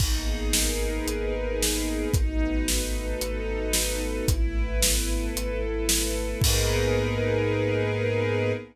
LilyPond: <<
  \new Staff \with { instrumentName = "String Ensemble 1" } { \time 4/4 \key gis \minor \tempo 4 = 112 dis'8 gis'8 ais'8 b'8 dis'8 gis'8 ais'8 b'8 | dis'8 b'8 dis'8 a'8 dis'8 b'8 a'8 dis'8 | e'8 b'8 e'8 a'8 e'8 b'8 a'8 e'8 | <dis' gis' ais' b'>1 | }
  \new Staff \with { instrumentName = "Synth Bass 2" } { \clef bass \time 4/4 \key gis \minor gis,,2 gis,,2 | gis,,2 gis,,2 | gis,,2 gis,,2 | gis,1 | }
  \new Staff \with { instrumentName = "String Ensemble 1" } { \time 4/4 \key gis \minor <ais b dis' gis'>1 | <a b dis' fis'>1 | <a b e'>1 | <ais b dis' gis'>1 | }
  \new DrumStaff \with { instrumentName = "Drums" } \drummode { \time 4/4 <cymc bd>4 sn4 hh4 sn4 | <hh bd>4 sn4 hh4 sn4 | <hh bd>4 sn4 hh4 sn4 | <cymc bd>4 r4 r4 r4 | }
>>